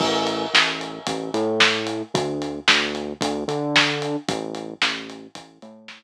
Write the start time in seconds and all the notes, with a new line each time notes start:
0.00 A1, kick, crash
0.27 closed hi-hat
0.54 A1, snare
0.81 closed hi-hat
1.07 A1, kick, closed hi-hat
1.34 A2, closed hi-hat
1.60 snare
1.87 closed hi-hat
2.14 D2, kick, closed hi-hat
2.42 closed hi-hat
2.68 D2, snare
2.95 closed hi-hat
3.21 D2, kick, closed hi-hat
3.48 D3, closed hi-hat
3.76 snare
4.02 closed hi-hat
4.28 A1, kick, closed hi-hat
4.55 closed hi-hat
4.82 A1, snare
5.10 closed hi-hat
5.35 A1, kick, closed hi-hat
5.62 A2, closed hi-hat
5.88 snare